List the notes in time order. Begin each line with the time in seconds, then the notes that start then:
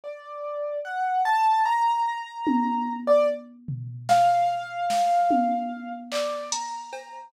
0.04 D5
0.85 F#5
1.25 A5
1.66 A#5
2.47 high tom
3.07 D5
3.68 floor tom
4.09 F5, snare
4.90 snare
5.31 high tom
6.12 D5, clap
6.52 A#5, closed hi-hat
6.93 cowbell